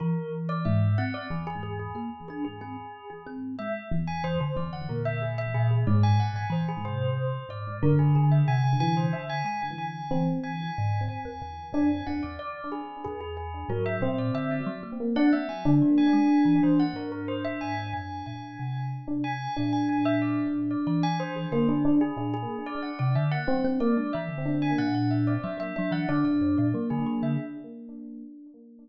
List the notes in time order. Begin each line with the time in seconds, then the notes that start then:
0.00 E3 A#4
0.49 D5
0.65 G#2 E5
0.98 C4 F#5
1.14 D5
1.30 E2 G#4
1.47 G#4
1.63 G#4
1.79 G#4
1.95 A#3 G#4
2.28 D4 G#4
2.45 G#4
2.61 C4 G#4
3.10 G#4
3.26 C4
3.59 G#3 E5
3.91 E2
4.07 G#5
4.24 E3 C5
4.40 D3 C5
4.55 E2 D3 D5
4.73 F#5
4.89 A#2 A#4
5.05 E5
5.22 G#4
5.38 E5
5.54 A#2 G#4
5.71 G#4
5.87 F#2 G#2 D5
6.03 G#5
6.20 F#5
6.34 G#2 G#5
6.50 E3 C5
6.68 G#4
6.84 C3 C5
7.49 G#2 D5
7.82 F#2 D3 A#4
7.99 G#4
8.15 D3 G#4
8.30 D3 E5
8.48 C3 G#5
8.64 G#5
8.80 E3 G#5
8.97 C5
9.13 D3 E5
9.29 G#5
9.44 G#3 G#5
9.62 G#5
9.78 G#5
10.11 E3 C4
10.43 G#5
10.78 G#2
11.08 F#2 G#5
11.25 E2
11.42 E2
11.73 F#2 D4 G#5
12.07 E2 D4 F#5
12.23 E2 D5
12.39 D5
12.72 G#4
13.04 E2 G#4
13.21 G#4
13.37 G#4
13.68 G#2 F#3 A#4
13.86 E5
14.01 A#2 C4 C5
14.18 D5
14.34 D3 E5
14.51 D5
14.66 F#3
14.83 A#3
15.00 A#3
15.15 D4 F#5
15.33 A#3 E5
15.49 F#3 G#5
15.65 D3 D4
15.82 F#3
15.98 G#5
16.13 G#3
16.45 E3
16.63 E3 C5
16.79 F#5
16.93 G#2 A#4
17.12 A#4
17.28 C5
17.45 E5
17.61 G#2 G#5
17.93 F#2 G#5
18.26 A#2 G#5
18.59 C3
19.08 D4
19.24 G#5
19.57 A#2 D4 G#5
19.73 G#5
19.89 G#5
20.05 E5
20.22 D5
20.71 D5
20.87 E3 D5
21.03 G#5
21.20 C5
21.36 G#4
21.51 D3 A#3 C5
21.68 D4 G#4
21.85 D4
22.01 G#4
22.16 A#2 D4 G#4
22.34 G#4
22.66 D5
22.82 F#5
22.99 C3 D5
23.15 D3 E5
23.32 F#5
23.47 F#3 C4
23.64 C4
23.80 A#3 D5
23.97 G#3 D4
24.13 E3 E5
24.29 D3
24.45 D4
24.62 G#5
24.78 A#2 F#5
24.94 F#5
25.11 E5
25.27 D5
25.43 F#3 E5
25.57 F#3 E5
25.76 F#3 D4 E5
25.91 E3 F#5
26.09 D3 D4 D5
26.24 A#2 D5
26.41 F#2
26.58 A#2 D5
26.74 F#3 A#3
26.90 D3 G#4
27.06 F#3 G#4
27.22 D3 E5